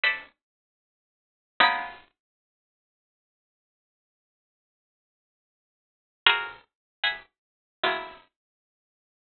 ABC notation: X:1
M:4/4
L:1/8
Q:1/4=77
K:none
V:1 name="Pizzicato Strings"
[ABcde]4 [_A,_B,=B,_D_E]4 | z8 | [F_G_A_Bc] z [e_g_a_bc']2 [E,_G,_A,_B,=B,]4 |]